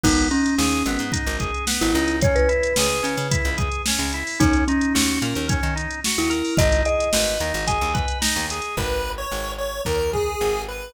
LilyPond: <<
  \new Staff \with { instrumentName = "Marimba" } { \time 4/4 \key gis \minor \tempo 4 = 110 dis'8 cis'4. r4 r16 e'8. | cis''16 b'2~ b'16 r4. | dis'8 cis'4. r4 r16 e'8. | dis''8 dis''4. gis''4 r4 |
r1 | }
  \new Staff \with { instrumentName = "Lead 1 (square)" } { \time 4/4 \key gis \minor r1 | r1 | r1 | r1 |
b'8. cis''8. cis''8 ais'8 gis'4 b'8 | }
  \new Staff \with { instrumentName = "Drawbar Organ" } { \time 4/4 \key gis \minor b8 dis'8 gis'8 b8 dis'8 gis'8 b8 dis'8 | cis'8 e'8 gis'8 cis'8 e'8 gis'8 cis'8 e'8 | cis'8 dis'8 fis'8 ais'8 cis'8 dis'8 fis'8 ais'8 | dis'8 gis'8 b'8 dis'8 gis'8 b'8 dis'8 gis'8 |
r1 | }
  \new Staff \with { instrumentName = "Electric Bass (finger)" } { \clef bass \time 4/4 \key gis \minor gis,,4 dis,8 gis,,16 gis,8 gis,,4 gis,,16 cis,8~ | cis,4 cis,8 cis16 cis8 cis,4 cis,8. | dis,4 dis,8 ais,16 dis,8 dis4 dis,8. | gis,,4 gis,,8 dis,16 gis,,8 dis,4 dis,8. |
gis,,4 gis,,4 dis,4 gis,,4 | }
  \new DrumStaff \with { instrumentName = "Drums" } \drummode { \time 4/4 <cymc bd>16 hh16 hh16 hh16 sn16 hh16 hh16 hh16 <hh bd>16 hh16 <hh bd>16 hh16 sn16 hh16 hh16 hh16 | <hh bd>16 hh16 hh16 hh16 sn16 hh16 hh16 hh16 <hh bd>16 hh16 <hh bd>16 hh16 sn16 hh16 hh16 hho16 | <hh bd>16 hh16 hh16 hh16 sn16 hh16 hh16 hh16 <hh bd>16 hh16 hh16 hh16 sn16 hh16 hh16 hho16 | <hh bd>16 hh16 hh16 hh16 sn16 hh16 hh16 hh16 <hh bd>16 hh16 <hh bd>16 hh16 sn16 hh16 hh16 hh16 |
bd4 r4 bd8 bd8 r4 | }
>>